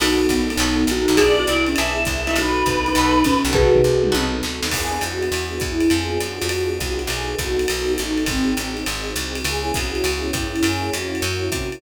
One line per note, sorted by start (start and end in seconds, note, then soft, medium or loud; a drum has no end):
0.00 0.27 B1 medium
0.00 0.23 B3 medium
0.00 0.44 B3 loud
0.00 0.57 B3 medium
0.00 0.23 D#4 medium
0.00 0.57 D#4 medium
0.00 0.49 D#4 loud
0.00 0.23 F#4 medium
0.00 0.57 F#4 loud
0.00 0.49 F#4 loud
0.00 0.23 A4 medium
0.00 0.57 A4 loud
0.00 ride loud
0.29 0.57 A#1 medium
0.29 kick soft
0.29 hi-hat pedal medium
0.29 ride medium
0.50 0.88 B3 medium
0.50 0.84 D#4 medium
0.50 ride medium
0.57 0.85 B1 loud
0.57 0.83 B3 medium
0.57 1.18 B3 loud
0.57 0.83 D#4 medium
0.57 1.20 D#4 medium
0.57 0.83 F#4 medium
0.57 1.20 F#4 medium
0.57 0.83 A4 medium
0.57 1.20 A4 medium
0.57 ride medium
0.87 1.06 A#1 medium
0.87 1.18 D#4 medium
0.87 hi-hat pedal medium
0.87 ride medium
0.91 1.19 F#4 medium
1.08 1.45 B1 loud
1.08 1.16 B3 medium
1.08 1.16 D#4 medium
1.08 1.16 F#4 medium
1.08 1.16 A4 medium
1.08 ride medium
1.17 1.42 B3 medium
1.17 1.76 B3 loud
1.17 1.42 D4 medium
1.17 1.76 D4 loud
1.17 1.42 E4 medium
1.17 1.76 E4 loud
1.17 1.33 G#4 loud
1.17 1.42 G#4 medium
1.17 1.76 G#4 loud
1.17 1.60 D5 loud
1.17 kick soft
1.17 ride medium
1.39 1.48 F#4 medium
1.47 1.75 C2 medium
1.47 1.66 E4 medium
1.47 hi-hat pedal medium
1.47 ride medium
1.66 1.76 C#4 medium
1.66 2.02 E5 medium
1.66 ride medium
1.76 2.06 B1 medium
1.76 2.35 B3 medium
1.76 2.02 B3 medium
1.76 2.35 D4 medium
1.76 2.02 D4 medium
1.76 2.35 E4 medium
1.76 2.02 E4 medium
1.76 2.35 G#4 loud
1.76 2.02 G#4 medium
1.76 ride medium
2.05 2.34 C2 medium
2.05 2.35 E5 medium
2.05 kick medium
2.05 hi-hat pedal medium
2.05 ride medium
2.27 2.61 B3 medium
2.27 2.61 D#4 medium
2.27 2.36 E4 loud
2.27 2.61 F#4 medium
2.27 2.61 A4 medium
2.27 ride medium
2.36 2.63 B1 medium
2.36 2.95 B3 medium
2.36 2.95 D#4 loud
2.36 2.78 D#4 medium
2.36 2.95 F#4 medium
2.36 2.78 F#4 loud
2.36 2.95 A4 medium
2.36 3.36 B4 loud
2.36 ride medium
2.66 2.93 C2 medium
2.66 kick medium
2.66 hi-hat pedal medium
2.66 ride medium
2.86 3.23 D#4 medium
2.86 ride medium
2.95 3.23 B1 loud
2.95 3.54 B3 medium
2.95 3.21 B3 medium
2.95 3.54 D#4 medium
2.95 3.21 D#4 medium
2.95 3.54 F#4 loud
2.95 3.21 F#4 medium
2.95 3.54 A4 loud
2.95 3.21 A4 medium
2.95 ride medium
3.24 3.44 A#1 medium
3.24 3.52 C#4 medium
3.24 kick medium
3.24 hi-hat pedal medium
3.24 ride medium
3.45 3.82 B1 loud
3.45 ride medium
3.53 3.77 B3 medium
3.53 4.12 B3 loud
3.53 3.77 D#4 medium
3.53 4.12 D#4 loud
3.53 3.77 F#4 medium
3.53 4.12 F#4 loud
3.53 4.11 F#4 loud
3.53 4.41 G#4 medium
3.53 3.77 A4 medium
3.53 4.12 A4 loud
3.53 4.41 B4 medium
3.53 kick medium
3.53 floor tom medium
3.75 floor tom medium
3.84 4.12 C2 medium
4.03 mid tom medium
4.12 4.42 B1 loud
4.12 4.36 B3 medium
4.12 4.71 B3 loud
4.12 4.36 D#4 medium
4.12 4.71 D#4 medium
4.12 4.36 F#4 loud
4.12 4.71 F#4 medium
4.12 4.36 A4 medium
4.12 4.71 A4 medium
4.12 high tom medium
4.43 4.61 D2 medium
4.43 snare medium
4.63 4.71 D#2 medium
4.63 snare loud
4.71 4.99 E2 medium
4.71 5.32 B3 loud
4.71 5.32 D4 loud
4.71 5.32 E4 loud
4.71 5.02 G#4 medium
4.71 5.32 G#4 medium
4.71 kick medium
4.71 crash medium
4.71 ride medium
5.01 5.29 F2 medium
5.01 5.60 F#4 medium
5.01 hi-hat pedal medium
5.01 ride medium
5.22 ride medium
5.32 5.59 E2 medium
5.32 5.89 B3 loud
5.32 5.89 D4 loud
5.32 5.91 E4 loud
5.32 5.89 G#4 medium
5.32 ride medium
5.60 5.89 E2 medium
5.60 5.90 E4 medium
5.60 kick medium
5.60 hi-hat pedal medium
5.60 ride medium
5.80 ride medium
5.90 6.18 F2 medium
5.90 6.48 B3 loud
5.90 6.48 D4 loud
5.90 6.48 F4 loud
5.90 6.48 G#4 loud
5.90 6.20 G#4 medium
5.90 ride medium
6.20 6.40 F#2 medium
6.20 6.75 F#4 medium
6.20 hi-hat pedal medium
6.20 ride medium
6.42 6.79 F2 medium
6.42 ride medium
6.49 7.09 B3 medium
6.49 7.10 D4 medium
6.49 7.10 F4 loud
6.49 7.10 G#4 loud
6.49 ride medium
6.78 7.08 C2 medium
6.78 7.06 F#4 medium
6.78 kick soft
6.78 hi-hat pedal medium
6.78 ride medium
6.99 ride medium
7.07 7.35 B1 loud
7.07 7.67 B3 loud
7.07 7.67 D#4 medium
7.07 7.67 F#4 loud
7.07 7.35 G#4 medium
7.07 7.67 A4 loud
7.07 ride medium
7.38 7.66 C2 medium
7.38 7.93 F#4 medium
7.38 kick medium
7.38 hi-hat pedal medium
7.38 ride medium
7.59 ride medium
7.68 7.97 B1 medium
7.68 8.26 B3 medium
7.68 8.26 D#4 loud
7.68 8.26 F#4 loud
7.68 8.26 A4 loud
7.68 ride medium
7.97 8.27 A1 medium
7.97 8.23 D#4 medium
7.97 hi-hat pedal medium
7.97 ride medium
8.18 ride medium
8.26 8.54 G#1 medium
8.26 8.73 C4 medium
8.26 8.85 C4 medium
8.26 8.85 D#4 loud
8.26 8.85 F#4 medium
8.26 8.85 G#4 medium
8.26 kick medium
8.26 ride medium
8.57 8.85 A1 medium
8.57 hi-hat pedal medium
8.57 ride medium
8.77 ride medium
8.86 9.14 G#1 medium
8.86 9.45 C4 loud
8.86 9.45 D#4 loud
8.86 9.45 F#4 medium
8.86 9.45 G#4 medium
8.86 ride medium
9.16 9.43 C2 medium
9.16 hi-hat pedal medium
9.16 ride medium
9.35 ride medium
9.44 9.72 C#2 medium
9.44 10.04 B3 medium
9.44 10.04 C#4 medium
9.44 10.04 E4 loud
9.44 10.04 G#4 loud
9.44 9.74 G#4 medium
9.44 ride medium
9.74 10.03 C2 medium
9.74 10.29 F#4 medium
9.74 kick medium
9.74 hi-hat pedal medium
9.74 ride medium
9.95 ride medium
10.04 10.31 C#2 medium
10.04 10.64 B3 medium
10.04 10.63 C#4 loud
10.04 10.63 E4 loud
10.04 10.64 G#4 loud
10.04 ride medium
10.33 10.61 G2 medium
10.33 10.64 E4 medium
10.33 kick medium
10.33 hi-hat pedal medium
10.33 ride medium
10.56 ride medium
10.63 10.90 F#2 medium
10.63 11.22 A#3 loud
10.63 11.22 C#4 loud
10.63 11.22 E4 loud
10.63 11.22 F#4 loud
10.63 10.90 G#4 medium
10.63 ride loud
10.93 11.21 F2 medium
10.93 11.49 F#4 medium
10.93 hi-hat pedal medium
10.93 ride medium
11.15 ride medium
11.22 11.50 F#2 loud
11.22 11.81 A#3 loud
11.22 11.81 C#4 loud
11.22 11.81 E4 loud
11.22 11.81 F#4 loud
11.22 ride medium
11.52 11.79 C3 medium
11.52 11.81 F#4 medium
11.52 kick medium
11.52 hi-hat pedal medium
11.52 ride medium
11.72 ride medium